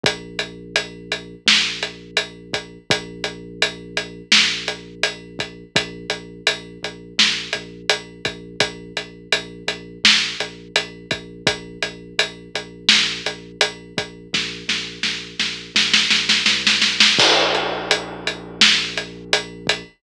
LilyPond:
<<
  \new Staff \with { instrumentName = "Synth Bass 2" } { \clef bass \time 4/4 \key bes \lydian \tempo 4 = 84 bes,,2 bes,,2 | bes,,2 bes,,2 | bes,,8 bes,,8 bes,,8 bes,,8 bes,,8 bes,,8 bes,,8 bes,,8 | bes,,8 bes,,8 bes,,8 bes,,8 bes,,8 bes,,8 bes,,8 bes,,8 |
bes,,8 bes,,8 bes,,8 bes,,8 bes,,8 bes,,8 bes,,8 bes,,8 | bes,,8 bes,,8 bes,,8 bes,,8 bes,,8 bes,,8 c,8 b,,8 | bes,,1 | }
  \new DrumStaff \with { instrumentName = "Drums" } \drummode { \time 4/4 <hh bd>8 hh8 hh8 hh8 sn8 hh8 hh8 <hh bd>8 | <hh bd>8 hh8 hh8 hh8 sn8 hh8 hh8 <hh bd>8 | <hh bd>8 hh8 hh8 hh8 sn8 hh8 hh8 <hh bd>8 | <hh bd>8 hh8 hh8 hh8 sn8 hh8 hh8 <hh bd>8 |
<hh bd>8 hh8 hh8 hh8 sn8 hh8 hh8 <hh bd>8 | <bd sn>8 sn8 sn8 sn8 sn16 sn16 sn16 sn16 sn16 sn16 sn16 sn16 | <cymc bd>8 hh8 hh8 hh8 sn8 hh8 hh8 <hh bd>8 | }
>>